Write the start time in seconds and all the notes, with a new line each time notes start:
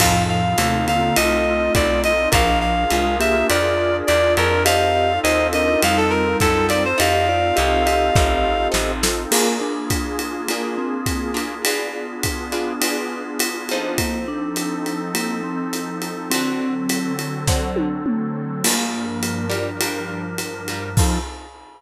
0.00 F2 A2 F3 C4 D#4 F4 A4 F5, kick, crash, ride
0.29 F5
0.58 D#2 C3 A3, hi-hat pedal, ride
0.87 D3 A#3 F5, ride
1.01 D3 A#3
1.16 C2 A3 F4 D#5, ride
1.75 B1 D5, kick, hi-hat pedal, ride
2.04 D#5, ride
2.32 A#1 F3 D4 F4 G#4 A#4 F5, kick, ride
2.61 F5
2.90 C2 G#3 F4, hi-hat pedal, ride
3.20 A#3 G4 E5, ride
3.34 A#3 G4
3.49 F2 F4 D5, ride
4.07 E2 D5, hi-hat pedal, ride
4.37 F2 A#4, ride
4.65 C4 D#4 F4 G4 A4 D#5 F5, ride
5.23 D#2 D#4 C5 D#5, hi-hat pedal, ride
5.53 D4 A#4 D#5, ride
5.67 D4 A#4
5.82 F2 G3 D#4 F5, ride
5.97 A4
6.10 A#4
6.40 F#2 A4, kick, hi-hat pedal, ride
6.69 C4 D#4 F4 A4 D5, ride
6.85 C5
6.98 F2 C4 D#4 F4 G4 A4 D#5 F5, ride
7.29 F4 D5
7.56 C2 G4 D#5, hi-hat pedal, ride
7.86 G4 D#5, ride
8.16 A1, kick, snare
8.72 A1 C4 D#4 F4 A4, snare
9.03 C4 D#4 F4 A4, snare
9.31 A#3 D4 F4 G#4, crash, ride
9.61 D4
9.90 kick, hi-hat pedal, ride
10.19 ride
10.48 A#3 D4 F4 G#4, ride
10.78 C4
11.06 kick, hi-hat pedal, ride
11.34 A#3 D4 F4 G#4, ride
11.65 B3 D4 F4 G#4, ride
12.23 kick, hi-hat pedal, ride
12.52 B3 D4 F4 G#4, ride
12.81 B3 D4 F4 G#4, ride
13.39 hi-hat pedal, ride
13.69 F3 C4 D#4 A4, ride
13.98 F3 A#3 C4 D#4 A4, kick, ride
14.28 D4
14.56 hi-hat pedal, ride
14.86 ride
15.14 A#3, ride
15.44 C4
15.73 hi-hat pedal, ride
16.02 ride
16.30 D3 F#3 C4 F#4 A4, ride
16.89 hi-hat pedal, ride
17.19 ride
17.47 D3 C4 F#4 A4, kick, snare
17.76 high tom
18.06 mid tom
18.64 G2 F3 G3 A#3 D4 F4 A#4, crash, ride
19.23 hi-hat pedal, ride
19.50 G3 D4 F4 A#4, ride
19.81 G3 D4 F4 A#4, ride
20.38 hi-hat pedal, ride
20.68 G3 D4 F4 A#4, ride
20.97 F3 C4 D#4 F4 A4, kick, crash